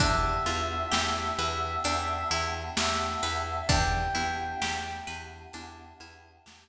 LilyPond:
<<
  \new Staff \with { instrumentName = "Brass Section" } { \time 4/4 \key e \minor \tempo 4 = 65 e''2. e''4 | g''4. r2 r8 | }
  \new Staff \with { instrumentName = "Pizzicato Strings" } { \time 4/4 \key e \minor d'8 f'8 g'8 b'8 d'8 e'8 g'8 b'8 | d'8 e'8 g'8 b'8 d'8 e'8 g'8 r8 | }
  \new Staff \with { instrumentName = "Electric Bass (finger)" } { \clef bass \time 4/4 \key e \minor e,8 e,8 e,8 e,8 e,8 e,8 e,8 e,8 | e,8 e,8 e,8 e,8 e,8 e,8 e,8 r8 | }
  \new Staff \with { instrumentName = "Choir Aahs" } { \time 4/4 \key e \minor <b d' e' g'>1 | <b d' e' g'>1 | }
  \new DrumStaff \with { instrumentName = "Drums" } \drummode { \time 4/4 <hh bd>4 sn4 hh4 sn4 | <hh bd>4 sn4 hh4 sn4 | }
>>